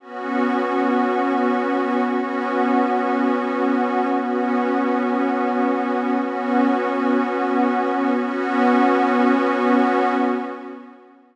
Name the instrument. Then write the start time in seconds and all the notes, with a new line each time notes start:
pad 5 (bowed)
0.00 B3 C#4 F#4
2.04 B3 C#4 F#4
4.10 B3 C#4 F#4
6.14 B3 C#4 F#4
8.18 B3 C#4 F#4